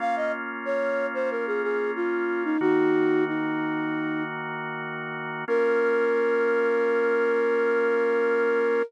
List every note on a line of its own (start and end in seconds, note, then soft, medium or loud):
0.00 2.57 A#3 medium
0.00 2.57 C#4 medium
0.00 2.57 F4 medium
0.00 0.15 F5 medium
0.16 0.32 D#5 medium
0.65 1.07 C#5 medium
1.14 1.30 C5 medium
1.31 1.46 A#4 medium
1.47 1.62 G#4 medium
1.63 1.91 G#4 medium
1.96 2.44 F4 medium
2.45 2.60 D#4 medium
2.61 5.45 D#3 medium
2.61 5.45 A#3 medium
2.61 3.24 D#4 medium
2.61 5.45 F#4 loud
2.61 3.24 F#4 medium
3.28 4.23 D#4 medium
5.48 8.82 A#3 loud
5.48 8.82 C#4 loud
5.48 8.82 F4 medium
5.48 8.82 A#4 loud